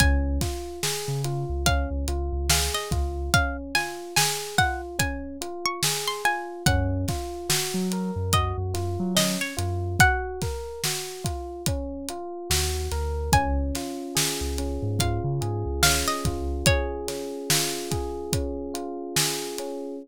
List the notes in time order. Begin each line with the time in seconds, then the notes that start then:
0.00 C#2 C#4 G#5, kick, closed hi-hat
0.41 F4, kick, snare, closed hi-hat
0.83 G#4, snare
1.08 C#3
1.24 F4, closed hi-hat
1.49 C#2
1.66 C#4 F5, kick, closed hi-hat
1.91 C#2
2.08 C#2 F4, closed hi-hat
2.33 C#2
2.49 G#4 F5, snare
2.74 D#5
2.91 C#2 F4, kick, closed hi-hat
3.34 C#4 F5, kick, closed hi-hat
3.75 F4 G#5, snare, closed hi-hat
4.16 G#4 G#5, snare
4.58 F4 F#5, kick, closed hi-hat
4.99 C#4 G#5, kick, closed hi-hat
5.41 F4, closed hi-hat
5.66 C#6
5.83 G#4, snare
6.07 C6
6.25 F4 G#5, closed hi-hat
6.66 F#2 C#4 F#5, kick, closed hi-hat
7.08 F4, kick, snare, closed hi-hat
7.49 F#4, snare
7.74 F#3
7.92 A#4, closed hi-hat
8.16 F#2
8.33 F#4 D#5, kick, closed hi-hat
8.58 F#2
8.74 F#2 F4, snare, closed hi-hat
9.00 F#3
9.15 C#4 D#5, snare
9.41 C#5
9.57 F#2 F4, closed hi-hat
9.99 F#4 F#5, kick, closed hi-hat
10.41 A#4, kick, snare, closed hi-hat
10.84 F#4, snare
11.24 F4, kick, closed hi-hat
11.66 C#4, kick, closed hi-hat
12.09 F4, closed hi-hat
12.50 D#2 F#4, snare
12.91 D2 A#4, snare, closed hi-hat
13.32 C#2 C#4 G#5, kick, closed hi-hat
13.75 F4, snare, closed hi-hat
14.15 G#4, snare
14.41 C#2
14.58 C#4, closed hi-hat
14.82 G#2
14.99 F4 F5, kick, closed hi-hat
15.24 C#3
15.41 G#2 G#4, closed hi-hat
15.66 C#2
15.83 C#4 F5, snare
16.08 D#5
16.25 C#2 F4, kick, closed hi-hat
16.66 G#4 C#5, kick, closed hi-hat
17.08 C#4, snare, closed hi-hat
17.50 F4, snare
17.91 G#4, kick, closed hi-hat
18.33 C#4, kick, closed hi-hat
18.74 F4, closed hi-hat
19.16 G#4, snare
19.58 C#4, closed hi-hat